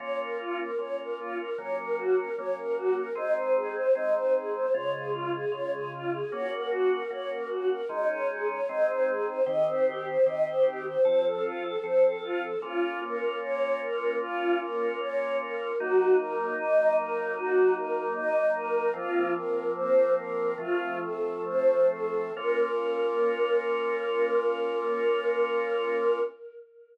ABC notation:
X:1
M:4/4
L:1/16
Q:1/4=76
K:Bbm
V:1 name="Choir Aahs"
d B F B d B F B d B G B d B G B | e c A c e c A c d A F A d A F A | d B G B d B G B e d A d e c A c | e c =G c e c G c c =A F A c A F A |
F2 B2 d2 B2 F2 B2 d2 B2 | G2 B2 e2 B2 G2 B2 e2 B2 | "^rit." F2 B2 c2 B2 F2 =A2 c2 A2 | B16 |]
V:2 name="Drawbar Organ"
[B,DF]4 [B,DF]4 [G,B,D]4 [G,B,D]4 | [A,CE]4 [A,CE]4 [D,A,F]4 [D,A,F]4 | [B,DG]4 [B,DG]4 [A,DE]4 [A,CE]4 | [E,C=G]4 [E,CG]4 [F,C=A]4 [F,CA]4 |
[B,DF]16 | [G,B,E]16 | "^rit." [F,B,C]8 [F,=A,C]8 | [B,DF]16 |]